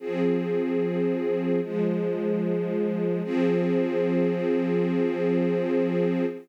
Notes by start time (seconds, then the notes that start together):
0.00 F3 C4 G#4
1.61 F3 G#3 G#4
3.24 F3 C4 G#4